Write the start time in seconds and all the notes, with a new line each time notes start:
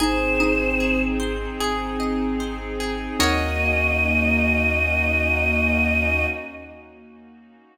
0.00 G#1 C4 D#4 G#4 C5
0.40 D#4 D#5
0.80 G#4
1.20 C5
1.60 G#1 G#4
2.00 D#5
2.40 C5
2.80 G#4
3.19 D#2 A#3 C#4 D#4 F#4 A#4 C#5 D#5